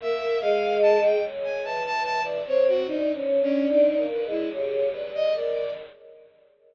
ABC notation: X:1
M:7/8
L:1/16
Q:1/4=73
K:none
V:1 name="Choir Aahs"
_B,2 _A,4 _D,2 E,4 C2 | (3D2 _D2 =D2 (3D2 _B,2 _A,2 _D,2 G,2 _E,2 |]
V:2 name="Violin"
e2 f2 a g z _a =a a a d _d _G | (3_E2 _D2 D2 E2 B =E G2 B _e =d2 |]